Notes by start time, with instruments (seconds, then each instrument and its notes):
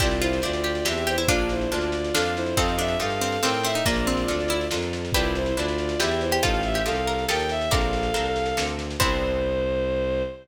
0.00 violin C2 F4 D5, orchestral harp C4 D4 E4 G4, pizzicato strings G4, kick, snare, crash
0.11 snare
0.21 violin E4 C5, pizzicato strings F4, snare
0.33 snare
0.42 violin D2 F4 D5, orchestral harp C4 D4 E4 G4, snare
0.53 snare
0.64 pizzicato strings G4, snare
0.75 snare
0.85 violin E2 G4 E5, orchestral harp C4 D4 E4 G4, pizzicato strings G4, snare
0.97 snare
1.07 violin E4 C5, pizzicato strings G4, snare
1.18 pizzicato strings E4, snare
1.28 violin A#1 F4 D5, orchestral harp A#3 D4 F4 A4, pizzicato strings D4 F4, kick, snare
1.38 snare
1.49 violin E4 C5, snare
1.61 snare
1.71 violin D2 F4 D5, orchestral harp A#3 D4 F4 A4, snare
1.81 snare
1.92 snare
2.04 snare
2.14 violin F2 A4 F5, orchestral harp A#3 D4 F4 A4, pizzicato strings D4, snare
2.26 snare
2.36 violin E4 C5, snare
2.46 snare
2.57 violin F2 A4 F5, pizzicato strings C4, orchestral harp D#4 F4 G4 A4, kick, snare
2.68 snare
2.78 pizzicato strings D4, violin E5, snare
2.88 snare
2.99 violin G2 A4 F5, orchestral harp D#4 F4 G4 A4, snare
3.10 snare
3.21 pizzicato strings C4, snare
3.32 snare
3.42 violin A2 A#4 G5, pizzicato strings C4, orchestral harp D#4 F4 G4 A4, snare
3.54 snare
3.63 pizzicato strings C4, violin E5, snare
3.74 pizzicato strings D#4, snare
3.86 violin A#1 F4 D5, pizzicato strings A#3, orchestral harp D4 F4 A4 A#4, kick, snare
3.96 snare
4.07 pizzicato strings C4, snare
4.17 snare
4.28 violin D2, orchestral harp D4 F4 A4 A#4, snare
4.40 snare
4.48 pizzicato strings E4, snare
4.61 snare
4.71 violin F2, orchestral harp D4 F4 A4 A#4, snare
4.82 snare
4.93 snare
5.05 snare
5.12 violin C2 F4 D5, orchestral harp C4 D4 E4 B4, pizzicato strings G4 B4, kick, snare
5.24 snare
5.35 violin E4 C5, snare
5.46 snare
5.56 violin D2 F4 D5, orchestral harp C4 D4 E4 B4, snare
5.68 snare
5.78 snare
5.89 snare
6.00 violin E2 G4 E5, orchestral harp C4 D4 E4 B4, pizzicato strings G4, snare
6.11 snare
6.21 violin E4 C5, snare
6.31 pizzicato strings G4, snare
6.43 violin A1 A4 F5, orchestral harp D#4 F4 G4 A4, pizzicato strings F4, kick, snare
6.54 snare
6.63 violin E5, snare
6.74 pizzicato strings G4, snare
6.86 violin C2 A4 F5, orchestral harp D#4 F4 G4 A4, snare
6.95 snare
7.07 pizzicato strings A#4, snare
7.18 snare
7.28 violin D#2 A#4 G5, orchestral harp D#4 F4 G4 A4, pizzicato strings A4, snare
7.39 snare
7.49 violin E5, snare
7.61 snare
7.71 violin A#1 A4 F5, orchestral harp C4 D4 A4 A#4, pizzicato strings A#4 D5, kick, snare
7.81 snare
7.93 snare
8.03 snare
8.14 violin C2, orchestral harp C4 D4 A4 A#4, snare
8.25 snare
8.36 snare
8.46 snare
8.57 violin D2, orchestral harp C4 D4 A4 A#4, snare
8.67 snare
8.79 snare
8.90 snare
9.00 violin C2 C5, orchestral harp B3 C4 D4 E4, pizzicato strings C5, kick, crash